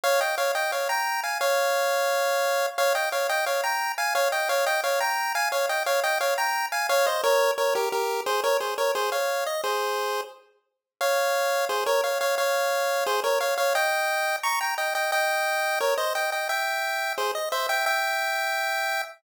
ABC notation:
X:1
M:4/4
L:1/8
Q:1/4=175
K:Fm
V:1 name="Lead 1 (square)"
[df] [eg] [df] [eg] [df] [gb]2 [fa] | [df]8 | [df] [eg] [df] [eg] [df] [gb]2 [fa] | [df] [eg] [df] [eg] [df] [gb]2 [fa] |
[df] [eg] [df] [eg] [df] [gb]2 [fa] | [df] [ce] [Bd]2 [Bd] [GB] [GB]2 | [Ac] [Bd] [Ac] [Bd] [Ac] [df]2 e | [Ac]4 z4 |
[df]4 [Ac] [Bd] [df] [df] | [df]4 [Ac] [Bd] [df] [df] | [eg]4 [bd'] [gb] [eg] [eg] | [eg]4 [Bd] [ce] [eg] [eg] |
[=eg]4 [Ac] ^d [ce] [eg] | [=eg]8 |]